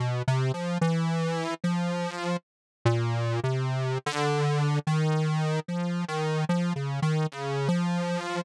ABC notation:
X:1
M:7/8
L:1/16
Q:1/4=74
K:none
V:1 name="Lead 1 (square)" clef=bass
(3B,,2 C,2 F,2 E,4 F,4 z2 | _B,,3 C,3 D,4 _E,4 | F,2 _E,2 (3F,2 _D,2 E,2 D,2 F,4 |]